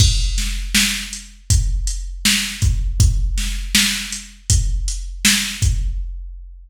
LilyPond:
\new DrumStaff \drummode { \time 4/4 \tempo 4 = 80 <cymc bd>8 <hh sn>8 sn8 hh8 <hh bd>8 hh8 sn8 <hh bd>8 | <hh bd>8 <hh sn>8 sn8 hh8 <hh bd>8 hh8 sn8 <hh bd>8 | }